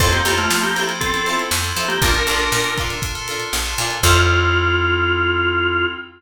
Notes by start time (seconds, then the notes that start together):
0.00 F2 C4 E4 F4 A4 C5, kick, crash
0.12 A#3 C4 E4 F4 G4 A4, closed hi-hat
0.25 F2 C4 E4 F4 A4 C5, closed hi-hat
0.38 A3 C4 E4 F4 A4, closed hi-hat
0.50 F3, snare
0.63 A#3 G4, closed hi-hat
0.75 C4 E4 F4 A4 C5, snare, closed hi-hat
0.79 E4
0.89 C4 E4 F4 A4, closed hi-hat
1.00 C4 E4 F4 A4, kick, closed hi-hat
1.13 C4 E4 F4 A4, closed hi-hat
1.26 E4 F4 A4 C5, closed hi-hat
1.38 snare, closed hi-hat
1.51 F2, snare
1.63 C4 E4 F4 A4, closed hi-hat
1.76 F3 E4 F4 A4 C5, closed hi-hat
1.88 A#3 G4, closed hi-hat
2.02 A#1 D4 F4 A4 A#4, kick, closed hi-hat
2.14 D4 F4 A4 A#4, closed hi-hat
2.27 A#1 D4 F4 A4 A#4, closed hi-hat
2.39 D4 F4 A4 A#4, closed hi-hat
2.52 A#2, snare
2.64 snare, closed hi-hat
2.77 D4 F4 A4 A#4, kick, closed hi-hat
2.90 D4 F4 A4 A#4, snare, closed hi-hat
3.02 D4 F4 A4 A#4, kick, closed hi-hat
3.15 D4 F4 A4 A#4, closed hi-hat
3.28 D4 F4 A4 A#4, closed hi-hat
3.40 closed hi-hat
3.53 A#1, snare
3.65 D4 F4 A4 A#4, closed hi-hat
3.78 A#2 D4 F4 A4 A#4, closed hi-hat
3.90 closed hi-hat
4.03 F2 C4 E4 F4 A4 C5, kick, crash